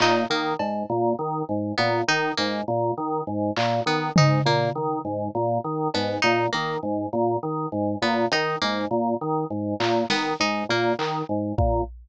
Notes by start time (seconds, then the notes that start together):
0.00 A#2 D#4, clap
0.30 D#3 A#3
0.59 G#2, cowbell
0.89 A#2
1.19 D#3
1.49 G#2
1.77 A#2 B3
2.08 D#3 D#4
2.37 G#2 A#3
2.68 A#2
2.97 D#3
3.27 G#2
3.56 A#2, clap
3.86 D#3 B3
4.16 G#2 D#4, floor tom
4.45 A#2 A#3
4.75 D#3
5.05 G#2
5.35 A#2
5.64 D#3
5.94 G#2 B3, cowbell
6.22 A#2 D#4
6.52 D#3 A#3
6.83 G#2
7.13 A#2
7.43 D#3
7.72 G#2
8.02 A#2 B3
8.32 D#3 D#4, closed hi-hat
8.62 G#2 A#3
8.91 A#2
9.21 D#3
9.50 G#2
9.80 A#2, clap
10.10 D#3 B3, snare
10.40 G#2 D#4
10.69 A#2 A#3
10.99 D#3, clap
11.29 G#2
11.58 A#2, kick